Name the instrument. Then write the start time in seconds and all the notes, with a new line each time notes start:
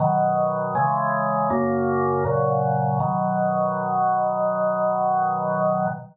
drawbar organ
0.00 B2 D#3 F#3
0.75 C#3 E3 G#3
1.50 F#2 C#3 A#3
2.25 A#2 C#3 F#3
3.00 B2 D#3 F#3